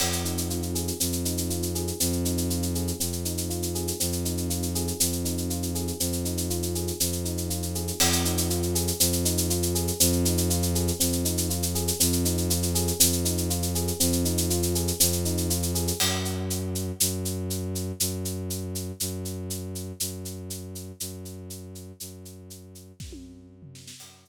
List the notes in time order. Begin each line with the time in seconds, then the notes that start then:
0.00 F2 C4, crash
0.12 shaker
0.25 D#4, shaker
0.38 shaker
0.50 F4, shaker
0.62 shaker
0.75 G#4, shaker
0.88 shaker
1.00 F2 C4, shaker
1.12 shaker
1.25 D#4, shaker
1.38 shaker
1.50 F4, shaker
1.62 shaker
1.75 G#4, shaker
1.87 shaker
2.00 F2 C4, shaker
2.12 shaker
2.25 D#4, shaker
2.38 shaker
2.50 F4, shaker
2.62 shaker
2.75 G#4, shaker
2.88 shaker
3.00 F2 C4, shaker
3.12 shaker
3.25 D#4, shaker
3.38 shaker
3.50 F4, shaker
3.62 shaker
3.75 G#4, shaker
3.88 shaker
4.00 F2 C4, shaker
4.12 shaker
4.25 D#4, shaker
4.37 shaker
4.50 F4, shaker
4.62 shaker
4.75 G#4, shaker
4.88 shaker
5.00 F2 C4, shaker
5.12 shaker
5.25 D#4, shaker
5.38 shaker
5.50 F4, shaker
5.62 shaker
5.75 G#4, shaker
5.88 shaker
6.00 F2 C4, shaker
6.12 shaker
6.25 D#4, shaker
6.38 shaker
6.50 F4, shaker
6.62 shaker
6.75 G#4, shaker
6.88 shaker
7.00 F2 C4, shaker
7.12 shaker
7.25 D#4, shaker
7.38 shaker
7.50 F4, shaker
7.62 shaker
7.75 G#4, shaker
7.88 shaker
8.00 F2 C4, crash
8.12 shaker
8.25 D#4, shaker
8.38 shaker
8.50 F4, shaker
8.62 shaker
8.75 G#4, shaker
8.88 shaker
9.00 F2 C4, shaker
9.12 shaker
9.25 D#4, shaker
9.38 shaker
9.50 F4, shaker
9.62 shaker
9.75 G#4, shaker
9.88 shaker
10.00 F2 C4, shaker
10.13 shaker
10.25 D#4, shaker
10.38 shaker
10.50 F4, shaker
10.62 shaker
10.75 G#4, shaker
10.88 shaker
11.00 F2 C4, shaker
11.12 shaker
11.25 D#4, shaker
11.38 shaker
11.50 F4, shaker
11.62 shaker
11.75 G#4, shaker
11.88 shaker
12.00 F2 C4, shaker
12.12 shaker
12.25 D#4, shaker
12.38 shaker
12.50 F4, shaker
12.63 shaker
12.75 G#4, shaker
12.88 shaker
13.00 F2 C4, shaker
13.12 shaker
13.25 D#4, shaker
13.38 shaker
13.50 F4, shaker
13.62 shaker
13.75 G#4, shaker
13.88 shaker
14.00 F2 C4, shaker
14.13 shaker
14.25 D#4, shaker
14.38 shaker
14.50 F4, shaker
14.63 shaker
14.75 G#4, shaker
14.88 shaker
15.00 F2 C4, shaker
15.12 shaker
15.25 D#4, shaker
15.37 shaker
15.50 F4, shaker
15.62 shaker
15.75 G#4, shaker
15.88 shaker
16.00 F#2, crash
16.25 shaker
16.50 shaker
16.75 shaker
17.00 F#2, shaker
17.25 shaker
17.50 shaker
17.75 shaker
18.00 F#2, shaker
18.25 shaker
18.50 shaker
18.75 shaker
19.00 F#2, shaker
19.25 shaker
19.50 shaker
19.75 shaker
20.00 F#2, shaker
20.25 shaker
20.50 shaker
20.75 shaker
21.00 F#2, shaker
21.25 shaker
21.50 shaker
21.75 shaker
22.00 F#2, shaker
22.25 shaker
22.50 shaker
22.75 shaker
23.00 F#2, kick, snare
23.12 high tom
23.62 floor tom
23.75 snare
23.88 snare
24.00 F#2, crash
24.25 shaker